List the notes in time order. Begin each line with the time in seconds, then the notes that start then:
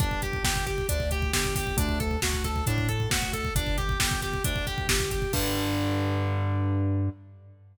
0.00 G1 D4, kick, closed hi-hat
0.11 kick
0.22 G4, kick, closed hi-hat
0.33 kick
0.42 G1 G4, kick, snare
0.56 kick
0.66 G4, kick, closed hi-hat
0.78 kick
0.89 D2 D4, kick, closed hi-hat
1.00 kick
1.11 G4, kick, closed hi-hat
1.22 kick
1.33 G1 G4, kick, snare
1.44 kick
1.56 G4, kick, open hi-hat
1.67 kick
1.77 D2 D4, kick, closed hi-hat
1.89 kick
2.00 A4, kick, closed hi-hat
2.11 kick
2.22 D2 F#4, kick, snare
2.34 kick
2.44 A4, kick, closed hi-hat
2.56 kick
2.66 A2 D4, kick, closed hi-hat
2.78 kick
2.89 A4, kick, closed hi-hat
3.00 kick
3.09 D2 F#4, kick, snare
3.22 kick
3.33 A4, kick, closed hi-hat
3.45 kick
3.55 G1 D4, kick, closed hi-hat
3.67 kick
3.78 G4, kick, closed hi-hat
3.89 kick
3.99 G1 G4, kick, snare
4.11 kick
4.22 G4, kick, closed hi-hat
4.33 kick
4.44 D2 D4, kick, closed hi-hat
4.56 kick
4.67 G4, kick, closed hi-hat
4.78 kick
4.87 G1 G4, kick, snare
5.00 kick
5.11 G4, kick, closed hi-hat
5.22 kick
5.33 G2 D3 G3, kick, crash